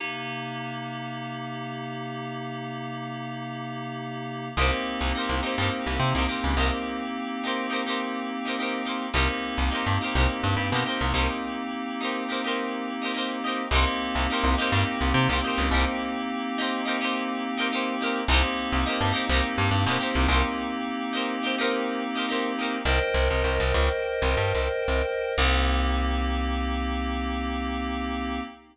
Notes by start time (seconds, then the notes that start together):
0.00 C3 A#3 D#4 G4
4.57 C2 A#3 C4 D#4 G4 A#4 C5
5.01 C2
5.15 D#4 G4 A#4 C5
5.29 C2
5.43 D#4 G4 A#4 C5
5.58 G2 D#4 G4 A#4 C5
5.87 C2
6.00 C3
6.15 C2 D#4 G4 A#4 C5
6.28 D#4 G4 A#4 C5
6.44 C#2
6.57 C2 D#4 G4 A#4 C5
7.44 D#4 G4 A#4 C5
7.70 D#4 G4 A#4 C5
7.86 D#4 G4 A#4 C5
8.45 D#4 G4 A#4 C5
8.59 D#4 G4 A#4 C5
8.85 D#4 G4 A#4 C5
9.14 C2 A#3 C4 D#4 G4 A#4 C5
9.58 C2
9.71 D#4 G4 A#4 C5
9.87 G2
10.01 D#4 G4 A#4 C5
10.15 C2 D#4 G4 A#4 C5
10.44 G2
10.57 G2
10.72 B2 D#4 G4 A#4
10.76 C5
10.85 D#4 G4 A#4 C5
11.01 C2
11.14 C2 D#4 G4 A#4 C5
12.01 D#4 G4 A#4 C5
12.29 D#4 G4 A#4 C5
12.44 D#4 G4 A#4 C5
13.02 D#4 G4 A#4 C5
13.15 D#4 G4 A#4 C5
13.44 D#4 G4 A#4 C5
13.71 C2 A#3 C4 D#4 G4 A#4
13.76 C5
14.15 C2
14.30 D#4 G4 A#4 C5
14.44 C2
14.58 D#4 G4 A#4 C5
14.72 G2 D#4 G4 A#4 C5
15.01 C2
15.14 C3
15.29 C2 D#4 G4 A#4 C5
15.44 D#4 G4 A#4 C5
15.58 C#2
15.71 C2 D#4 G4 A#4 C5
16.58 D#4 G4 A#4 C5
16.85 D#4 G4 A#4 C5
17.01 D#4 G4 A#4 C5
17.57 D#4 G4 A#4 C5
17.72 D#4 G4 A#4 C5
18.01 D#4 G4 A#4 C5
18.28 C2 A#3 C4 D#4 G4
18.32 A#4 C5
18.73 C2
18.86 D#4 G4 A#4 C5
19.01 G2
19.13 D#4 G4 A#4 C5
19.29 C2 D#4 G4 A#4
19.34 C5
19.58 G2
19.71 G2
19.87 B2 D#4 G4 A#4
19.91 C5
19.99 D#4 G4 A#4 C5
20.15 C2
20.28 C2 D#4 G4 A#4 C5
21.13 D#4 G4 A#4 C5
21.43 D#4 G4 A#4 C5
21.58 D#4 G4 A#4 C5
22.15 D#4 G4 A#4 C5
22.29 D#4 G4 A#4 C5
22.59 D#4 G4 A#4 C5
22.85 C2 A#4 C5 D#5 G5
23.14 C2
23.31 C2
23.44 C2
23.60 C2
23.74 C#2
24.22 C2
24.37 G2
24.54 C2
24.88 C2
25.38 C2 A#3 C4 D#4 G4